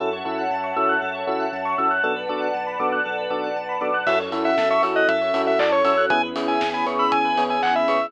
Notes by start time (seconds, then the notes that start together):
0.00 F#2 C#4 E4 F#4 A4 C#5 E5 F#5 A5
0.13 C#5
0.25 F#2 C#4 E4 F#4 A4 E5
0.38 F#5
0.51 F#2 A5
0.64 C#6
0.76 F#2 C#4 E4 F#4 A4 E6
0.89 F#6
1.02 F#2 A4
1.15 C#5
1.27 F#2 C#4 E4 F#4 A4 E5
1.40 F#5
1.52 F#2 A5
1.65 C#6
1.78 F#2 C#4 E4 F#4 A4 E6
1.91 F#6
2.03 B1 B3 D4 F#4 A4 B4 D5 F#5 A5
2.16 B4
2.29 B1 B3 D4 F#4 A4 D5
2.42 F#5
2.54 B1 A5
2.67 B5
2.79 B1 B3 D4 F#4 A4 D6
2.92 F#6
3.05 B1 A4
3.18 B4
3.30 B1 B3 D4 F#4 A4 D5
3.44 F#5
3.56 B1 A5
3.69 B5
3.81 B1 B3 D4 F#4 A4 D6
3.94 F#6
4.07 F#2 C#4 E4 F#4 A4 E5, kick, crash
4.19 C#5
4.32 F#2 C#4 E4 F#4 A4 E5, open hi-hat
4.45 E5 F#5
4.57 F#2 A5, kick, snare
4.70 E5 C#6
4.83 F#2 C#4 E4 F#4 A4 E6, open hi-hat
4.96 D#5 F#6
5.08 F#2 A4 E5, kick, closed hi-hat
5.21 C#5
5.34 F#2 C#4 E4 F#4 A4 E5, open hi-hat
5.47 E5 F#5
5.59 F#2 D5 A5, kick, clap
5.72 C#5 C#6
5.85 F#2 C#4 E4 F#4 A4 E6, open hi-hat
5.97 F#6
6.10 E2 B3 C#4 E4 G#4 G#5, kick, closed hi-hat
6.23 B4
6.36 E2 B3 C#4 E4 G#4 C#5, open hi-hat
6.48 E5 G#5
6.61 E2 G#5, kick, snare
6.74 G#5 B5
6.86 E2 B3 C#4 E4 G#4 C#6, open hi-hat
6.99 B5 E6
7.12 E2 G#4 G#5, kick, closed hi-hat
7.25 B4
7.37 E2 B3 C#4 E4 G#4 C#5, open hi-hat
7.50 E5 G#5
7.63 E2 F#5 G#5, kick, clap
7.75 E5 B5
7.88 E2 B3 C#4 E4 G#4 C#6, open hi-hat
8.01 E6